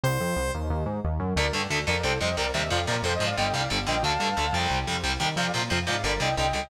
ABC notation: X:1
M:4/4
L:1/8
Q:1/4=180
K:Dphr
V:1 name="Distortion Guitar"
z8 | [Bd] z2 [Bd] [Ac] [ce] [Bd] =e | [df] [Bd] (3[Ac] [ce] [df] [eg] [df] z [eg] | [fa]4 z4 |
[df] z2 [df] [Bd] [eg] [eg] [eg] |]
V:2 name="Lead 2 (sawtooth)"
c3 z5 | z8 | z8 | z8 |
z8 |]
V:3 name="Overdriven Guitar"
z8 | [D,A,] [D,A,] [D,A,] [D,A,] [C,G,] [C,G,] [C,G,] [C,G,] | [C,F,] [C,F,] [C,F,] [C,F,] [D,G,] [D,G,] [D,G,] [D,G,] | [D,A,] [D,A,] [D,A,] [C,G,]2 [C,G,] [C,G,] [C,G,] |
[C,F,] [C,F,] [C,F,] [C,F,] [D,G,] [D,G,] [D,G,] [D,G,] |]
V:4 name="Synth Bass 1" clef=bass
C,, F,, C,, E,, E,, _A,, E,, _G,, | D,, G,, D,, F,, C,, F,, C,, E,, | F,, B,, F,, _A,, G,,, C,, G,,, B,,, | D,, G,, D,, F,, C,, F,, C,, E,, |
F,, B,, F,, _A,, G,,, C,, C,, ^C,, |]